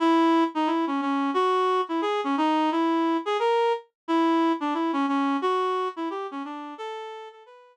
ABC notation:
X:1
M:4/4
L:1/8
Q:"Swing" 1/4=177
K:Bdor
V:1 name="Clarinet"
E3 ^D E C C2 | F3 E G C ^D2 | E3 G ^A2 z2 | E3 D E C C2 |
F3 E =G C D2 | A3 A B2 z2 |]